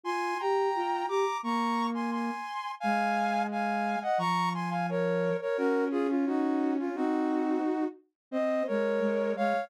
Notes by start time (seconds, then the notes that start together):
0.03 F4 G#5 C6
0.39 G4 G5 A#5
0.75 F4
1.08 G4 A#5 D6
1.43 A#3 A#5 C#6
1.94 G#5 C6
2.12 G#5 C6
2.80 G#3 F5 G#5
3.51 F5 G#5
4.02 D#5 F#5
4.18 F3 A#5 C#6
4.54 G#5 C6
4.70 F5 G#5
4.89 A#4 C#5
5.41 A#4 C#5
5.57 C#4 F#4 A#4
5.91 F4 G#4
6.09 C#4 F4
6.27 D#4 F#4
6.79 C#4 F4
6.95 C4 D#4 F#4
8.31 C4 C5 D#5
8.67 G#3 A#4 C#5
9.00 G#3
9.36 G#3 C#5 F5